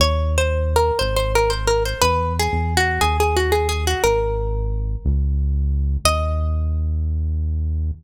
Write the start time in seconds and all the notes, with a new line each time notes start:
0.00 D#2 C#5
0.38 C5
0.76 A#4
0.99 G#1 C5
1.16 C5
1.35 A#4
1.50 C5
1.67 A#4
1.86 C5
2.02 E2 B4
2.39 G#4
2.53 E2
2.77 F#4
3.01 D#2 G#4
3.20 G#4
3.37 F#4
3.52 G#4
3.69 G#4
3.87 F#4
4.04 G#1 A#4
5.05 C#2
6.05 D#2 D#5